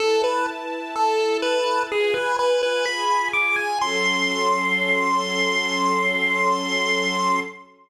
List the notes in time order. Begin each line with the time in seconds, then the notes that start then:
0.00 E4 A4 B4 A5
0.24 B4
0.95 E4 A4 A5
1.42 B4
1.90 F4 G#4 B4 G#5
2.14 B4
2.39 B4
2.63 B4
2.86 F4 G#4 G#5 B5
3.33 D6
3.56 G#5
3.80 F#3 C#4 A4 C6